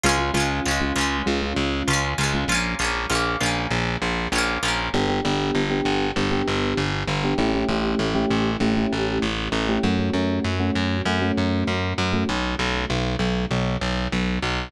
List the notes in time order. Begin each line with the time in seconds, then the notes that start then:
0.04 C#2 G#3 C#4 F4
0.09 G#3
0.19 G#3 C#4 F4
0.34 C#2 G#3 C#4 F4
0.40 G#3
0.66 C#2 C#4 F4
0.71 G#3
0.81 G#3 C#4 F4
0.96 C#2 C#4 F4
1.01 G#3
1.26 C#2 G#3 C#4 F4
1.42 G#3 C#4 F4
1.57 C#2
1.88 C#2 C#4 F4
1.93 G#3
2.18 C#2 C#4 F4
2.24 G#3
2.34 G#3 C#4 F4
2.48 A#1 C#4 F4
2.55 A#3
2.79 A#1 C#4 F4
2.84 A#3
3.10 A#1 C#4 F4
3.15 A#3
3.41 A#1 C#4 F4
3.46 A#3
3.71 A#1
4.02 A#1
4.32 A#1 C#4 F4
4.38 A#3
4.63 A#1 C#4 F4
4.68 A#3
4.94 G1 B3 D4 G4
5.09 B3 D4 G4
5.25 G1 B3 D4 G4
5.55 G1
5.70 B3 D4 G4
5.85 G1
6.16 G1 B3 D4 G4
6.31 B3 D4 G4
6.48 G1
6.77 G1
7.08 G1
7.24 B3 D4 G4
7.38 A1 A3 C#4 E4 G4
7.54 A3 C#4 E4 G4
7.69 A1 A3 C#4 E4 G4
7.99 A1
8.15 A3 C#4 E4 G4
8.30 A1
8.60 A1 A3 C#4 E4 G4
8.77 A3 C#4 E4 G4
8.93 A1
9.22 A1
9.52 A1
9.68 A3 C#4 E4 G4
9.83 F#2 A3 C#4 F#4
9.99 A3 C#4 F#4
10.14 F#2 A3 C#4 F#4
10.45 F#2
10.60 A3 C#4 F#4
10.76 F#2
11.05 F#2 A3 C#4 F#4
11.22 A3 C#4 F#4
11.38 F#2
11.67 F#2
11.98 F#2
12.13 A3 C#4 F#4
12.29 B1
12.59 B1
12.90 B1
13.19 B1
13.51 B1
13.82 B1
14.13 B1
14.42 B1